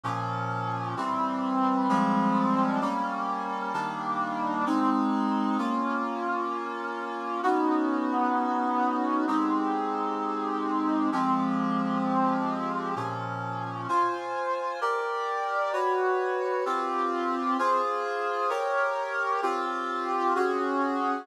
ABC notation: X:1
M:6/8
L:1/8
Q:3/8=130
K:Fm
V:1 name="Brass Section"
[B,,F,D]6 | [=E,G,C]6 | [F,G,A,C]6 | [G,B,D]6 |
[E,G,B,=D]6 | [A,CE]6 | [K:Bbm] [B,DF]6- | [B,DF]6 |
[_CDEG]6- | [_CDEG]6 | [A,CE=G]6- | [A,CE=G]6 |
[F,A,C=G]6- | [F,A,C=G]6 | [B,,F,D]6 | [K:Fm] [Fca]6 |
[GB=d]6 | [_G_cd]6 | [CFG]6 | [FAc]6 |
[GBd]6 | [CFG]6 | [D_GA]6 |]